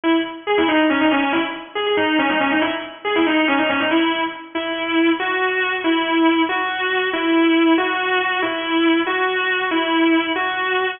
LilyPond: \new Staff { \time 6/8 \key gis \minor \tempo 4. = 186 e'8 r4. gis'8 e'8 | dis'4 cis'8 dis'8 cis'8 cis'8 | e'8 r4. gis'8 gis'8 | dis'4 cis'8 dis'8 cis'8 dis'8 |
e'8 r4. gis'8 e'8 | dis'4 cis'8 dis'8 cis'8 dis'8 | e'4. r4. | \key cis \minor e'2. |
fis'2. | e'2. | fis'2. | e'2. |
fis'2. | e'2. | fis'2. | e'2. |
fis'2. | }